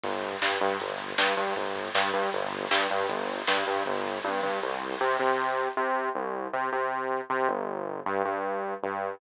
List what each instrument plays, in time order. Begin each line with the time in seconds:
0.04 synth bass 1 G1, kick
0.13 kick
0.23 kick, closed hi-hat
0.32 kick
0.42 synth bass 1 G2, kick, snare
0.51 kick
0.61 synth bass 1 G2, kick, closed hi-hat
0.70 kick
0.80 synth bass 1 G1, kick, closed hi-hat
0.90 kick
0.99 kick, closed hi-hat
1.09 kick
1.18 synth bass 1 G2, kick, snare
1.28 kick
1.37 synth bass 1 G2, kick, closed hi-hat
1.47 kick
1.56 synth bass 1 G1, kick, closed hi-hat
1.66 kick
1.76 kick, closed hi-hat
1.85 kick
1.95 synth bass 1 G2, kick, snare
2.04 kick
2.14 synth bass 1 G2, kick, closed hi-hat
2.23 kick
2.33 synth bass 1 G1, kick, closed hi-hat
2.42 kick
2.52 kick, closed hi-hat
2.62 kick
2.71 synth bass 1 G2, kick, snare
2.80 kick
2.90 synth bass 1 G2, kick, closed hi-hat
3.00 kick
3.09 synth bass 1 G1, kick, closed hi-hat
3.19 kick
3.29 kick, closed hi-hat
3.38 kick
3.47 synth bass 1 G2, kick, snare
3.57 kick
3.66 synth bass 1 G2, kick, closed hi-hat
3.76 kick
3.86 synth bass 1 G1, kick
4.05 floor tom
4.24 synth bass 1 G2, high tom
4.43 synth bass 1 G2, floor tom
4.62 synth bass 1 C2
5.00 synth bass 1 C3
5.20 synth bass 1 C3
5.77 synth bass 1 C3
6.15 synth bass 1 C2
6.53 synth bass 1 C3
6.72 synth bass 1 C3
7.30 synth bass 1 C3
7.49 synth bass 1 G1
8.06 synth bass 1 G2
8.25 synth bass 1 G2
8.83 synth bass 1 G2